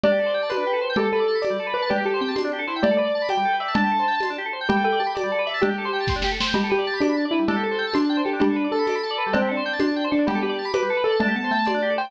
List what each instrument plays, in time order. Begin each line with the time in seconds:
0.03 drawbar organ D4, xylophone G4, acoustic grand piano D5, cowbell, low conga
0.12 drawbar organ G4
0.19 drawbar organ A4
0.26 drawbar organ C5
0.34 drawbar organ G5
0.43 drawbar organ A5
0.49 acoustic grand piano B4, drawbar organ C6, tambourine, cowbell, high conga
0.57 drawbar organ D4
0.67 drawbar organ G4
0.73 drawbar organ A4
0.81 drawbar organ C5
0.90 drawbar organ G5
0.96 drawbar organ G3, xylophone G4, acoustic grand piano A4, cowbell, low conga
1.04 drawbar organ A4
1.13 acoustic grand piano A4, drawbar organ B4
1.20 drawbar organ D5
1.28 drawbar organ A5
1.35 drawbar organ B5
1.42 acoustic grand piano D5, drawbar organ D6, tambourine, cowbell, high conga
1.50 drawbar organ G3
1.59 drawbar organ A4
1.67 drawbar organ B4
1.74 acoustic grand piano B4, drawbar organ D5
1.82 drawbar organ A5
1.89 drawbar organ D4, xylophone G4, acoustic grand piano G4, cowbell, low conga
1.98 drawbar organ G4
2.05 acoustic grand piano G4, drawbar organ A4
2.14 drawbar organ C5
2.21 xylophone C4, drawbar organ G5
2.28 drawbar organ A5
2.35 acoustic grand piano D4, drawbar organ C6, tambourine, cowbell, high conga
2.44 drawbar organ D4
2.53 drawbar organ G4
2.59 drawbar organ A4
2.67 acoustic grand piano E4, drawbar organ C5
2.76 drawbar organ G5
2.82 drawbar organ G3, xylophone A3, acoustic grand piano D5, cowbell, low conga
2.91 drawbar organ A4
2.97 drawbar organ B4, acoustic grand piano D5
3.05 drawbar organ D5
3.15 drawbar organ A5
3.22 drawbar organ B5
3.29 acoustic grand piano G5, drawbar organ D6, tambourine, cowbell, high conga
3.37 drawbar organ G3
3.45 drawbar organ A4
3.53 drawbar organ B4
3.60 drawbar organ D5, acoustic grand piano E5
3.68 drawbar organ A5
3.74 drawbar organ D4, xylophone D4, acoustic grand piano A5, cowbell, low conga
3.84 drawbar organ G4
3.91 drawbar organ A4
3.99 drawbar organ C5
4.08 drawbar organ G5
4.15 drawbar organ A5
4.20 drawbar organ C6, tambourine, cowbell, high conga
4.30 drawbar organ D4
4.38 drawbar organ G4
4.46 drawbar organ A4
4.53 drawbar organ C5
4.61 drawbar organ G5
4.69 drawbar organ G3, xylophone G4, acoustic grand piano G5, cowbell, low conga
4.76 drawbar organ A4
4.84 xylophone A4, drawbar organ B4, acoustic grand piano G5
4.92 drawbar organ D5
4.99 xylophone G4, drawbar organ A5
5.07 drawbar organ B5
5.15 acoustic grand piano D5, drawbar organ D6, tambourine, cowbell, high conga
5.23 drawbar organ G3
5.32 drawbar organ A4
5.39 drawbar organ B4
5.46 drawbar organ D5, acoustic grand piano E5
5.54 drawbar organ A5
5.61 drawbar organ D4, acoustic grand piano G4, xylophone G4, cowbell, low conga
5.69 drawbar organ G4
5.78 drawbar organ A4
5.85 drawbar organ C5
5.93 drawbar organ G5
6.00 drawbar organ A5
6.07 drawbar organ C6, kick, snare
6.16 drawbar organ D4
6.22 drawbar organ G4, snare
6.32 drawbar organ A4
6.40 drawbar organ C5, snare
6.47 drawbar organ G5
6.54 drawbar organ G3, xylophone G4, acoustic grand piano G4, cowbell, low conga
6.64 drawbar organ A4
6.70 acoustic grand piano G4, drawbar organ B4
6.78 drawbar organ D5
6.87 drawbar organ A5
6.93 drawbar organ B5
7.00 acoustic grand piano D4, drawbar organ D6, tambourine, cowbell, high conga
7.09 drawbar organ B5
7.17 drawbar organ A5
7.25 drawbar organ D5
7.31 acoustic grand piano E4, drawbar organ B4
7.39 drawbar organ G3
7.48 drawbar organ D4, xylophone G4, acoustic grand piano A4, cowbell, low conga
7.56 drawbar organ G4
7.63 drawbar organ A4, acoustic grand piano A4
7.71 drawbar organ C5
7.78 drawbar organ G5
7.87 drawbar organ A5
7.94 acoustic grand piano D4, drawbar organ C6, tambourine, cowbell, high conga
8.02 drawbar organ A5
8.09 drawbar organ G5
8.17 drawbar organ C5
8.24 acoustic grand piano G4, drawbar organ A4
8.33 drawbar organ D4
8.40 drawbar organ G3, acoustic grand piano D4, xylophone G4, cowbell, low conga
8.49 drawbar organ A4
8.56 drawbar organ B4
8.64 drawbar organ D5
8.72 acoustic grand piano A4, drawbar organ A5
8.79 drawbar organ B5
8.87 drawbar organ D6, tambourine, cowbell, high conga
8.95 drawbar organ B5
9.03 drawbar organ A5
9.10 drawbar organ D5
9.18 drawbar organ B4
9.26 drawbar organ G3
9.33 acoustic grand piano C4, xylophone C4, drawbar organ D4, cowbell, low conga
9.42 drawbar organ G4
9.49 acoustic grand piano D4, drawbar organ A4
9.57 drawbar organ C5
9.66 drawbar organ G5
9.73 drawbar organ A5
9.80 acoustic grand piano D4, drawbar organ C6, tambourine, cowbell, high conga
9.87 drawbar organ A5
9.96 drawbar organ G5
10.04 drawbar organ C5
10.11 acoustic grand piano D4, drawbar organ A4
10.19 drawbar organ D4
10.27 drawbar organ G3, xylophone B3, acoustic grand piano G4, cowbell, low conga
10.35 drawbar organ A4
10.42 acoustic grand piano G4, drawbar organ B4
10.49 drawbar organ D5
10.59 drawbar organ A5
10.65 drawbar organ B5
10.73 acoustic grand piano B4, drawbar organ D6, tambourine, cowbell, high conga
10.82 drawbar organ G3
10.90 drawbar organ A4
10.97 drawbar organ B4
11.04 acoustic grand piano A4, drawbar organ D5
11.12 drawbar organ A5
11.20 xylophone A3, drawbar organ D4, acoustic grand piano A5, cowbell, low conga
11.28 drawbar organ G4
11.36 xylophone B3, drawbar organ A4, acoustic grand piano A5
11.44 drawbar organ C5
11.51 xylophone A3, drawbar organ G5
11.58 drawbar organ A5
11.65 acoustic grand piano D5, drawbar organ C6, tambourine, cowbell, high conga
11.74 drawbar organ D4
11.82 drawbar organ G4
11.90 drawbar organ A4
11.98 drawbar organ C5, acoustic grand piano G5
12.05 drawbar organ G5